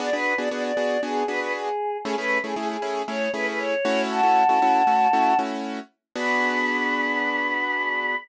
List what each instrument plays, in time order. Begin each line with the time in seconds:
0.00 acoustic grand piano B3 D4 F#4 G#4, choir aahs D5
0.13 acoustic grand piano B3 D4 F#4 G#4, choir aahs B4
0.37 acoustic grand piano B3 D4 F#4 G#4, choir aahs D5
0.51 acoustic grand piano B3 D4 F#4 G#4, choir aahs D5
0.64 choir aahs D5
0.77 acoustic grand piano B3 D4 F#4 G#4
1.03 acoustic grand piano B3 D4 F#4 G#4, choir aahs G#4
1.27 acoustic grand piano B3 D4 F#4 G#4, choir aahs B4
1.40 choir aahs B4
1.55 choir aahs G#4
2.03 acoustic grand piano A3 C#4 E4 G#4, choir aahs G#4
2.18 acoustic grand piano A3 C#4 E4 G#4, choir aahs B4
2.44 acoustic grand piano A3 C#4 E4 G#4, choir aahs G#4
2.56 acoustic grand piano A3 C#4 E4 G#4, choir aahs G#4
2.70 choir aahs G#4
2.82 acoustic grand piano A3 C#4 E4 G#4
3.08 acoustic grand piano A3 C#4 E4 G#4, choir aahs C#5
3.34 acoustic grand piano A3 C#4 E4 G#4, choir aahs B4
3.47 choir aahs B4
3.59 choir aahs C#5
3.85 acoustic grand piano A3 C#4 E4 F#4
4.10 choir aahs F#5 A5
4.23 acoustic grand piano A3 C#4 E4 F#4
4.49 acoustic grand piano A3 C#4 E4 F#4
4.62 acoustic grand piano A3 C#4 E4 F#4
4.87 acoustic grand piano A3 C#4 E4 F#4
5.13 acoustic grand piano A3 C#4 E4 F#4
5.39 acoustic grand piano A3 C#4 E4 F#4
6.15 acoustic grand piano B3 D4 F#4 G#4, choir aahs B5